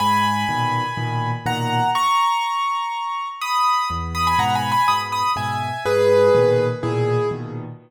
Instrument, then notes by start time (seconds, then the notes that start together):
acoustic grand piano
0.00 G#2 G#5 B5
0.49 A#2 B2 D#3
0.97 A#2 B2 D#3
1.46 A#2 B2 D#3 F#5 A#5
1.95 A#5 C#6
3.41 B5 D#6
3.90 E2
4.15 B5 D#6
4.27 G#5 B5
4.39 G#2 B2 F#5 A#5
4.55 G#5 B5
4.72 G#5 B5
4.88 G#2 B2 B5 D#6
5.12 B5 D#6
5.36 G#2 B2 E5 G#5
5.85 G#2 G#4 B4
6.35 A#2 B2 D#3
6.83 A#2 B2 D#3 E4 G#4
7.31 A#2 B2 D#3